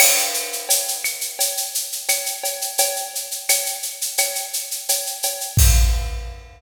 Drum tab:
CC |x---------------|----------------|x---------------|
SH |-xxxxxxxxxxxxxxx|xxxxxxxxxxxxxxxx|----------------|
CB |x---x---x---x-x-|x---x---x---x-x-|----------------|
CL |x-----x-----x---|----x---x-------|----------------|
BD |----------------|----------------|o---------------|